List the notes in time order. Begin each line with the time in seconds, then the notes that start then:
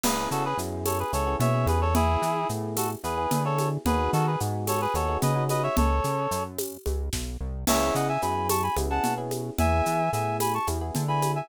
0.04 C#2 B3 C#4 E4 G#4 B4, crash, low conga, shaker
0.31 C#3 F#4 A4, shaker
0.45 G#4 B4
0.57 F#2 B3 C#4 E4 G#4, shaker
0.85 A4 C#5, tambourine, high conga, shaker
0.99 G#4 B4
1.13 C#2 B3 C#4 E4 G#4 A4 C#5, shaker
1.27 B3 C#4 E4 G#4
1.40 B2 C#5 E5, low conga, shaker
1.54 B3 C#4 E4 G#4
1.66 E2 G#4 B4, high conga, shaker
1.81 A4 C#5
1.95 B3 E4 G#4, low conga, shaker
2.22 E3, shaker
2.49 A2 B3 E4 G#4, shaker
2.77 F#4 A4, tambourine, high conga, shaker
3.04 E2 B3 E4 G#4 B4, shaker
3.18 B3 E4 G#4
3.31 D3, low conga, shaker
3.45 B3 E4 G#4 A4 C#5
3.59 high conga, shaker
3.85 D#2 B3 D#4 F#4 G#4 B4, low conga, shaker
4.13 D#3 F#4 A4, shaker
4.26 G#4 B4
4.40 G#2 B3 D#4 F#4 G#4, shaker
4.67 A4 C#5, tambourine, high conga, shaker
4.81 G#4 B4
4.94 D#2 B3 D#4 F#4 G#4 A4 C#5, high conga, shaker
5.08 B3 D#4 F#4 G#4
5.22 C#3 B4 D#5, low conga, shaker
5.35 B3 D#4 F#4 G#4
5.49 B4 D#5, high conga, shaker
5.63 C#5 E5
5.77 C#2 A4 C#5, low conga, shaker
6.04 C#3, shaker
6.31 F#2, shaker
6.58 tambourine, high conga, shaker
6.86 C#2, high conga, shaker
7.13 B1, kick, snare
7.40 C2
7.67 C#2 B3 C#4 E4 G#4 C#5 E5, crash, low conga, shaker
7.95 C#3 D#5 F#5, shaker
8.09 E5 G#5
8.22 F#2 B3 C#4 E4 G#4 G#5 B5, shaker
8.49 A5 C#6, tambourine, high conga, shaker
8.63 G#5 B5
8.77 C#2 B3 C#4 E4 G#4, high conga, shaker
8.90 B3 C#4 E4 G#4 F#5 A5
9.04 B2, low conga, shaker
9.18 B3 C#4 E4 G#4
9.31 high conga, shaker
9.58 E2 B3 E4 G#4 E5 G#5, low conga, shaker
9.86 E3, shaker
10.13 A2 B3 E4 G#4 E5 G#5, shaker
10.40 G#5 B5, tambourine, high conga, shaker
10.54 A5 C#6
10.67 E2 B3 E4 G#4, high conga, shaker
10.81 B3 E4 G#4
10.95 D3, low conga, shaker
11.08 B3 E4 G#4 G#5 B5
11.22 high conga, shaker
11.35 E5 G#5